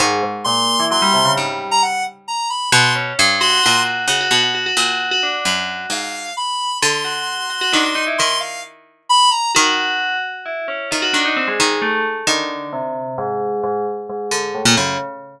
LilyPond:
<<
  \new Staff \with { instrumentName = "Lead 1 (square)" } { \time 6/8 \tempo 4. = 88 r4 c'''4 c'''4 | r8. ais''16 fis''8 r8 ais''8 b''8 | c'''8 r4 c'''4 r8 | r2. |
r4 f''4 b''4 | c'''2. | c'''8 f''8 r4 b''8 ais''8 | r2. |
r2. | r2. | r2. | }
  \new Staff \with { instrumentName = "Tubular Bells" } { \time 6/8 gis,8 gis,16 r16 ais,8. e16 fis16 g16 c16 cis16 | g4 r2 | r8 cis'8 r8 fis'8 fis'4 | fis'16 fis'16 fis'16 fis'16 fis'16 fis'4 fis'16 d'8 |
fis'4 r2 | r8 fis'4 fis'16 fis'16 d'16 fis'16 dis'16 e'16 | r2. | fis'4. r8 e'8 cis'8 |
f'16 fis'16 d'16 dis'16 c'16 gis8. a8 r8 | d4 c4 gis,4 | gis,8 r8 gis,4 a,8 cis8 | }
  \new Staff \with { instrumentName = "Pizzicato Strings" } { \clef bass \time 6/8 dis2 r4 | gis,2. | b,4 g,4 ais,4 | cis8 b,4 ais,4. |
fis,4 gis,4 r4 | d2 dis4 | dis2. | dis4. r4. |
dis8 dis4 dis4. | dis2. | r4. d8. ais,16 fis,8 | }
>>